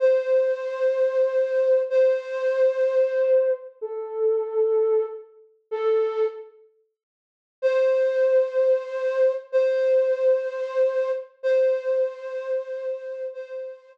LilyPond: \new Staff { \time 6/8 \key c \dorian \tempo 4. = 63 c''2. | c''2. | a'2 r4 | a'4 r2 |
c''2. | c''2. | c''2. | c''4 r2 | }